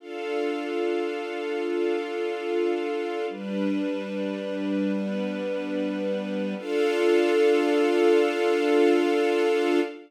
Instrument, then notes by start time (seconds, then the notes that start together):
string ensemble 1
0.00 D4 F4 A4 F5
1.65 D4 F4 F5
3.29 G3 D4 B4
4.93 G3 B3 B4
6.58 D4 F4 A4 F5